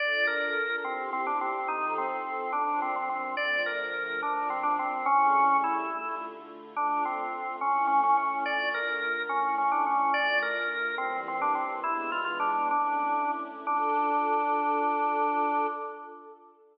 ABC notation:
X:1
M:6/8
L:1/16
Q:3/8=71
K:Dm
V:1 name="Drawbar Organ"
d2 B4 C2 C D C2 | _E2 C4 D2 C C C2 | d2 B4 D2 C D C2 | ^C4 E4 z4 |
D2 C4 ^C2 C C C2 | d2 B4 ^C2 C D C2 | d2 B4 C2 C D C2 | "^rit." E2 F F D2 D4 z2 |
D12 |]
V:2 name="String Ensemble 1"
[DFA]6 [CEG]6 | [F,C_EA]6 [B,,F,D]6 | [D,F,A,]6 [B,,F,D]6 | [^C,G,A,E]6 [D,A,F]6 |
[D,A,F]6 [A,^CE]6 | [D,A,F]6 [A,^CE]6 | [D,A,F]6 [E,G,B,]6 | "^rit." [E,^G,=B,D]6 [A,^CE]6 |
[DFA]12 |]